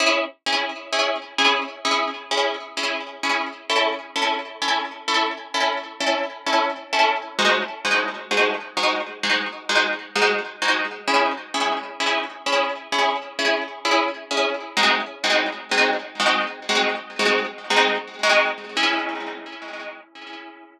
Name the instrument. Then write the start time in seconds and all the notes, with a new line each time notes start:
orchestral harp
0.00 C#4 E4 G#4
0.46 C#4 E4 G#4
0.93 C#4 E4 G#4
1.38 C#4 E4 G#4
1.85 C#4 E4 G#4
2.31 C#4 E4 G#4
2.77 C#4 E4 G#4
3.23 C#4 E4 G#4
3.69 C#4 E4 A4
4.16 C#4 E4 A4
4.62 C#4 E4 A4
5.08 C#4 E4 A4
5.54 C#4 E4 A4
6.00 C#4 E4 A4
6.46 C#4 E4 A4
6.93 C#4 E4 A4
7.38 G#3 D#4 F#4 C5
7.85 G#3 D#4 F#4 C5
8.31 G#3 D#4 F#4 C5
8.77 G#3 D#4 F#4 C5
9.23 G#3 D#4 F#4 C5
9.69 G#3 D#4 F#4 C5
10.15 G#3 D#4 F#4 C5
10.62 G#3 D#4 F#4 C5
11.08 C#4 E4 G#4
11.54 C#4 E4 G#4
12.00 C#4 E4 G#4
12.46 C#4 E4 G#4
12.92 C#4 E4 G#4
13.39 C#4 E4 G#4
13.85 C#4 E4 G#4
14.31 C#4 E4 G#4
14.77 G#3 C4 D#4 F#4
15.24 G#3 C4 D#4 F#4
15.71 G#3 C4 D#4 F#4
16.19 G#3 C4 D#4 F#4
16.69 G#3 C4 D#4 F#4
17.19 G#3 C4 D#4 F#4
17.70 G#3 C4 D#4 F#4
18.23 G#3 C4 D#4 F#4
18.77 C#4 E4 G#4